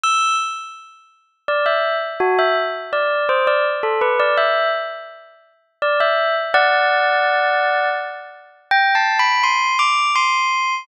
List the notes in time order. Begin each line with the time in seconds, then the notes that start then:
0.04 E6
1.48 D5
1.66 E5
2.20 F#4
2.39 E5
2.93 D5
3.29 C5
3.47 D5
3.83 A4
4.01 B4
4.20 D5
4.38 E5
5.82 D5
6.00 E5
6.54 D5 F#5
8.71 G5
8.95 A5
9.19 B5
9.44 C6
9.79 D6
10.16 C6